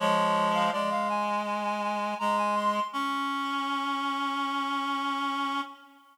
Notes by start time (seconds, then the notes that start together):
0.00 F3 G#3 C#5
0.54 F5
0.72 G#3 D5
0.91 F5
1.10 G#5
1.46 G#5
1.64 G#5
1.83 G#5
2.19 G#3 A#5
2.38 G#5
2.55 C6
2.93 C#4 C#6